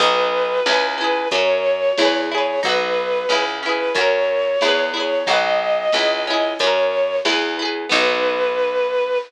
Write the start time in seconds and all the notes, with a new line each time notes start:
0.00 B1 B3 D#4 B4, kick, closed hi-hat
0.06 F#4
0.66 C#2 C#4 E4, snare
0.72 G#4
0.98 C#4 E4 B4
1.04 G#4
1.31 F#2 C#4 C#5, kick, closed hi-hat
1.35 F#4 A#4
1.98 E2 E4, snare
2.02 G#4 B4
2.31 E4 G#4 C#5
2.38 B4
2.63 B1 D#4 F#4 B4, kick, closed hi-hat
2.69 B4
3.29 C#2 C#4 E4, snare
3.35 G#4
3.63 C#4 E4 B4
3.69 G#4
3.95 F#2 C#4 F#4 C#5, kick, closed hi-hat
4.01 A#4
4.61 E2 E4 G#4, snare
4.68 B4
4.94 E4 G#4 C#5
5.00 B4
5.26 B1 D#4 F#4 D#5, kick, closed hi-hat
5.33 B4
5.92 C#2 C#4 E4, snare
5.99 G#4
6.26 C#4 D#5
6.30 E4 G#4
6.59 F#2 C#4 C#5, kick, closed hi-hat
6.64 F#4 A#4
7.25 E2 E4, snare
7.29 G#4 B4
7.59 E4 G#4
7.65 B4
7.89 B1 B3 D#4 B4, kick, crash
7.96 F#4